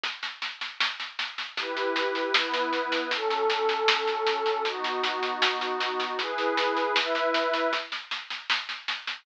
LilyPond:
<<
  \new Staff \with { instrumentName = "Pad 2 (warm)" } { \time 2/4 \key e \dorian \tempo 4 = 78 r2 | <e' g' b'>4 <b e' b'>4 | \key fis \dorian <fis cis' a'>2 | <b dis' fis'>2 |
<e' gis' b'>4 <e' b' e''>4 | r2 | }
  \new DrumStaff \with { instrumentName = "Drums" } \drummode { \time 2/4 <bd sn>16 sn16 sn16 sn16 sn16 sn16 sn16 sn16 | <bd sn>16 sn16 sn16 sn16 sn16 sn16 sn16 sn16 | <bd sn>16 sn16 sn16 sn16 sn16 sn16 sn16 sn16 | <bd sn>16 sn16 sn16 sn16 sn16 sn16 sn16 sn16 |
<bd sn>16 sn16 sn16 sn16 sn16 sn16 sn16 sn16 | <bd sn>16 sn16 sn16 sn16 sn16 sn16 sn16 sn16 | }
>>